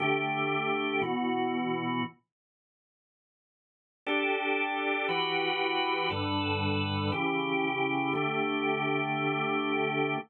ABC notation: X:1
M:4/4
L:1/8
Q:1/4=118
K:D
V:1 name="Drawbar Organ"
[D,A,G]4 [B,,E,F]4 | z8 | [DGA]4 [E,FGB]4 | [G,,D,AB]4 [C,E,G]4 |
[D,A,G]8 |]